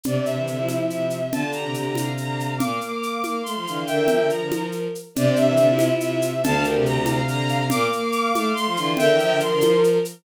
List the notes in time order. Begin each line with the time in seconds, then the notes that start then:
0.03 C3 D4 D5, low conga, shaker
0.16 C3 C4
0.24 C3 D4 E5, shaker
0.37 E3 E4
0.47 D3 D4 E5, shaker
0.57 F3 E4
0.69 high conga, shaker
0.89 C3 E5, shaker
1.10 shaker
1.32 D3 F4 A5, low conga, shaker
1.43 D3
1.52 D3 G4 A#5, shaker
1.64 C3
1.74 C3 A#5, shaker
1.85 C3
1.95 F5, high conga, shaker
2.17 D3 A#5, shaker
2.28 F5
2.40 F5, shaker
2.58 A#2 A#3 F5 D6, low conga, shaker
2.81 A#3 F5 D6, shaker
3.00 D6, shaker
3.22 A#3 F5, high conga, shaker
3.43 A3 C6, shaker
3.55 F3 F5
3.66 D3 E3 F5, shaker
3.86 D3 A#4 E5 G5, shaker
3.98 E3
4.08 F3, low conga, shaker
4.20 D3
4.30 F3 A#5, shaker
4.41 D3
4.51 F3, high conga, shaker
4.72 shaker
4.95 shaker
5.15 C3 D4 D5, low conga, shaker
5.25 C3 C4
5.36 C3 D4 E5, shaker
5.47 E3 E5
5.57 D3 D4 E5, shaker
5.69 E4 F4
5.79 high conga, shaker
6.00 C3 E5, shaker
6.22 shaker
6.42 D2 D3 F5 A5, low conga, shaker
6.54 D3
6.63 D3 G4 A#4, shaker
6.75 C3
6.86 C3 A#5, shaker
6.97 C3
7.06 F5, high conga, shaker
7.27 D3 A#5, shaker
7.39 F5
7.49 F5, shaker
7.70 A#2 A#3 F5 D6, low conga, shaker
7.90 A#3 F5 D6, shaker
8.12 D6, shaker
8.33 A3 F5, high conga, shaker
8.54 A3 C6, shaker
8.66 F3 F5
8.77 D3 E3 F4, shaker
8.97 D3 A#4 E5 G5, low conga, shaker
9.09 E3
9.19 F3, shaker
9.30 D3
9.40 F3 C6, shaker
9.52 D3
9.61 F3, high conga, shaker
9.84 shaker
10.05 shaker